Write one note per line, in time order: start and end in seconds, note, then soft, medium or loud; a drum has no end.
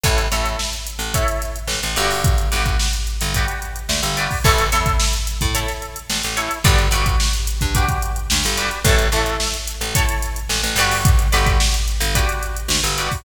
0.03 0.28 A1 medium
0.03 0.26 E4 medium
0.03 0.26 A4 medium
0.03 0.26 C#5 medium
0.03 kick loud
0.03 closed hi-hat loud
0.18 closed hi-hat medium
0.32 0.56 A1 medium
0.32 0.76 E4 medium
0.32 0.76 A4 loud
0.32 0.76 C#5 medium
0.32 closed hi-hat medium
0.45 closed hi-hat medium
0.59 snare loud
0.73 snare soft
0.73 closed hi-hat medium
0.87 closed hi-hat medium
0.99 1.24 A1 medium
0.99 closed hi-hat medium
1.14 1.58 E4 medium
1.14 1.58 A4 medium
1.14 1.58 C#5 medium
1.14 kick loud
1.14 closed hi-hat loud
1.28 closed hi-hat medium
1.42 snare soft
1.42 closed hi-hat medium
1.56 closed hi-hat medium
1.67 1.80 A1 medium
1.67 snare loud
1.83 1.96 A1 medium
1.83 snare soft
1.83 closed hi-hat medium
1.96 2.49 G1 medium
1.96 2.46 F#4 loud
1.96 2.46 G4 loud
1.96 2.46 B4 loud
1.96 2.46 D5 loud
1.96 closed hi-hat medium
2.10 open hi-hat medium
2.24 kick loud
2.24 closed hi-hat loud
2.38 closed hi-hat medium
2.52 2.77 G1 medium
2.52 2.96 F#4 medium
2.52 2.96 G4 medium
2.52 2.96 B4 medium
2.52 2.96 D5 medium
2.52 closed hi-hat medium
2.66 kick medium
2.66 closed hi-hat medium
2.79 snare loud
2.93 closed hi-hat medium
3.07 closed hi-hat medium
3.21 3.46 G1 medium
3.21 closed hi-hat loud
3.34 3.79 F#4 medium
3.34 3.79 G4 medium
3.34 3.79 B4 medium
3.34 3.79 D5 medium
3.34 kick medium
3.34 closed hi-hat loud
3.48 closed hi-hat medium
3.62 closed hi-hat medium
3.76 closed hi-hat medium
3.89 4.01 D2 medium
3.89 snare loud
4.03 4.28 G1 medium
4.03 closed hi-hat medium
4.17 4.39 F#4 medium
4.17 4.39 G4 medium
4.17 4.39 B4 medium
4.17 4.39 D5 medium
4.17 closed hi-hat medium
4.31 kick medium
4.31 open hi-hat medium
4.44 4.70 A1 medium
4.44 4.66 E4 loud
4.44 4.66 A4 loud
4.44 4.66 C#5 loud
4.44 kick loud
4.44 crash loud
4.58 closed hi-hat medium
4.72 4.97 E2 medium
4.72 5.16 E4 medium
4.72 5.16 A4 loud
4.72 5.16 C#5 medium
4.72 snare soft
4.72 closed hi-hat loud
4.86 kick loud
4.86 closed hi-hat medium
5.00 snare loud
5.13 closed hi-hat medium
5.27 closed hi-hat loud
5.41 5.66 A2 medium
5.41 kick loud
5.41 closed hi-hat medium
5.54 5.99 E4 medium
5.54 5.99 A4 medium
5.54 5.99 C#5 medium
5.54 closed hi-hat loud
5.68 snare medium
5.68 closed hi-hat medium
5.82 closed hi-hat medium
5.96 closed hi-hat medium
6.10 6.22 A1 medium
6.10 snare loud
6.23 6.49 A1 medium
6.23 closed hi-hat medium
6.37 6.59 E4 medium
6.37 6.59 A4 medium
6.37 6.59 C#5 medium
6.37 closed hi-hat medium
6.51 closed hi-hat medium
6.64 6.89 G1 medium
6.64 6.87 F#4 loud
6.64 6.87 G4 loud
6.64 6.87 B4 loud
6.64 6.87 D5 loud
6.64 kick loud
6.64 closed hi-hat loud
6.78 closed hi-hat medium
6.91 7.15 G1 medium
6.91 7.36 F#4 loud
6.91 7.36 G4 medium
6.91 7.36 B4 medium
6.91 7.36 D5 loud
6.91 closed hi-hat loud
7.06 kick loud
7.06 closed hi-hat medium
7.20 snare loud
7.33 closed hi-hat medium
7.47 closed hi-hat loud
7.61 7.86 G2 medium
7.61 kick medium
7.61 closed hi-hat medium
7.75 8.19 F#4 medium
7.75 8.19 G4 loud
7.75 8.19 B4 medium
7.75 8.19 D5 medium
7.75 kick loud
7.75 closed hi-hat loud
7.88 kick loud
7.88 closed hi-hat medium
8.02 closed hi-hat medium
8.16 closed hi-hat medium
8.30 8.44 D2 medium
8.30 snare loud
8.44 8.70 G1 medium
8.44 closed hi-hat medium
8.57 8.79 F#4 medium
8.57 8.79 G4 medium
8.57 8.79 B4 loud
8.57 8.79 D5 loud
8.57 snare soft
8.57 closed hi-hat medium
8.71 closed hi-hat medium
8.84 9.09 A1 medium
8.84 9.07 E4 loud
8.84 9.07 A4 loud
8.84 9.07 C#5 loud
8.84 kick loud
8.84 closed hi-hat loud
8.99 closed hi-hat medium
9.12 9.37 A1 medium
9.12 9.57 E4 medium
9.12 9.57 A4 loud
9.12 9.57 C#5 medium
9.12 closed hi-hat medium
9.26 closed hi-hat medium
9.40 snare loud
9.54 snare soft
9.54 closed hi-hat medium
9.67 closed hi-hat loud
9.81 10.06 A1 medium
9.81 closed hi-hat medium
9.95 10.39 E4 loud
9.95 10.39 A4 medium
9.95 10.39 C#5 loud
9.95 kick loud
9.95 closed hi-hat loud
10.09 closed hi-hat loud
10.22 snare soft
10.22 closed hi-hat loud
10.36 closed hi-hat medium
10.49 10.62 A1 medium
10.49 snare loud
10.63 10.76 A1 medium
10.63 snare soft
10.63 closed hi-hat medium
10.76 11.28 G1 medium
10.76 11.27 F#4 loud
10.76 11.27 G4 loud
10.76 11.27 B4 loud
10.76 11.27 D5 loud
10.76 closed hi-hat medium
10.91 open hi-hat medium
11.05 kick loud
11.05 closed hi-hat loud
11.19 closed hi-hat medium
11.32 11.58 G1 medium
11.32 11.76 F#4 medium
11.32 11.76 G4 medium
11.32 11.76 B4 loud
11.32 11.76 D5 medium
11.32 closed hi-hat loud
11.46 kick loud
11.46 closed hi-hat medium
11.60 snare loud
11.74 closed hi-hat medium
11.88 closed hi-hat medium
12.00 12.25 G1 medium
12.00 closed hi-hat loud
12.15 12.59 F#4 medium
12.15 12.59 G4 medium
12.15 12.59 B4 medium
12.15 12.59 D5 loud
12.15 kick loud
12.15 closed hi-hat loud
12.29 closed hi-hat medium
12.43 closed hi-hat medium
12.56 closed hi-hat medium
12.68 12.81 D2 medium
12.68 snare loud
12.83 13.08 G1 medium
12.83 closed hi-hat medium
12.98 13.20 F#4 medium
12.98 13.20 G4 medium
12.98 13.20 B4 medium
12.98 13.20 D5 medium
12.98 closed hi-hat medium
13.11 kick medium
13.11 open hi-hat medium